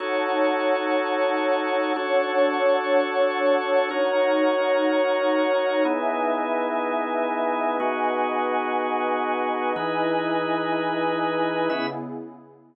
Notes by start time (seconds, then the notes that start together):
0.00 D#4 F#4 A4 C#5 F#5 A5
1.96 D4 F#4 A4 C#5 F#5 A5
3.91 D#4 F#4 A#4 C#5 F#5 A#5
5.85 B3 D#4 E4 G#4 B4 D#5 E5 G#5
7.80 B3 D#4 F#4 G#4 B4 D#5 F#5 G#5
9.75 E3 D#4 E4 G#4 B4 D#5 G#5
11.70 C#3 B3 C#4 E4 G#4 B4 E5